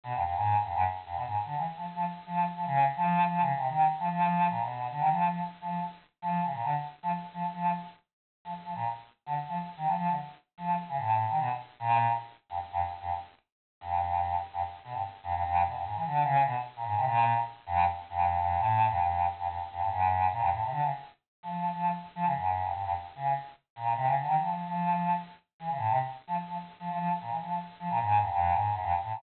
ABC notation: X:1
M:6/4
L:1/16
Q:1/4=148
K:none
V:1 name="Choir Aahs" clef=bass
B,, F,, F,, _A,,2 z F,, _G,, z2 F,, B,, A,, z D, E, z F, z F, z2 F,2 | z F, _D,2 z F,3 (3F,2 D,2 C,2 _E,2 z F, F,4 _B,, =B,,3 | D, _E, F,2 F, z2 F,2 z4 F,2 _D, _B,, =D, z3 F, z2 | F, z F,2 z7 F, z F, _B,, z4 D, z F, z2 |
_E, F, F, D, z4 F,2 z _D, A,,3 E, B,, z3 _B,,3 z | z3 F,, z F,, z2 F,, z7 F,,6 z F,, | z2 B,, G,, z2 F,, F,, F,,2 B,, F,, _A,, E, D,2 _D,2 B,, z2 _B,, A,, C, | _B,,3 z3 F,,2 z2 F,,3 F,,2 A,,3 F,, F,,3 z F,, |
F,, z F,, G,, _G,,4 _B,, F,, A,, C, D, _D, z5 F,3 F,2 | z2 F, _D, _G,,3 F,, =G,, F,, z2 D,2 z4 _B,,2 C, D, =D, _E, | F,3 F,5 z4 E, _D, A,, C, z3 F, z F, z2 | F, F, F, z _B,, E, F,2 z2 F, B,, _A,,2 F,, F,,2 A,,2 _G,, F,, z =A,, B,, |]